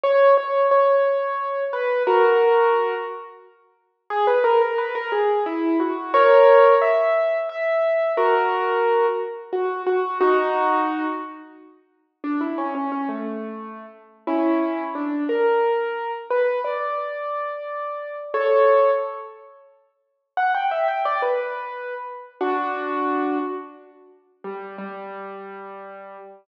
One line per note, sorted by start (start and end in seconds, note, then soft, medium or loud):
0.04 0.35 C#5 loud
0.37 0.66 C#5 medium
0.71 1.64 C#5 medium
1.73 2.03 B4 medium
2.07 2.94 F#4 medium
2.07 2.94 A#4 medium
4.10 4.26 G#4 loud
4.27 4.43 B4 medium
4.44 4.60 A#4 medium
4.61 4.78 A#4 medium
4.78 4.94 B4 medium
4.95 5.11 A#4 loud
5.12 5.44 G#4 medium
5.46 5.78 E4 medium
5.80 6.12 F#4 medium
6.14 6.75 A#4 medium
6.14 6.75 C#5 loud
6.81 7.37 E5 medium
7.49 8.12 E5 medium
8.17 9.06 F#4 medium
8.17 9.06 A#4 medium
9.53 9.82 F#4 medium
9.87 10.18 F#4 medium
10.21 11.06 D#4 medium
10.21 11.06 F#4 loud
12.24 12.40 D4 medium
12.41 12.57 E4 medium
12.58 12.74 C#4 medium
12.75 12.91 C#4 medium
12.92 13.08 C#4 medium
13.09 13.86 A3 medium
14.27 14.84 C#4 medium
14.27 14.84 E4 medium
14.95 15.24 D4 medium
15.29 16.11 A#4 medium
16.31 16.59 B4 medium
16.64 18.16 D5 medium
18.34 18.91 A4 medium
18.34 18.91 C#5 medium
20.37 20.53 F#5 medium
20.55 20.71 G5 medium
20.71 20.87 E5 medium
20.88 21.04 G5 medium
21.05 21.21 D5 medium
21.22 21.94 B4 medium
22.41 23.38 D4 medium
22.41 23.38 F#4 medium
24.44 24.76 G3 medium
24.78 26.17 G3 medium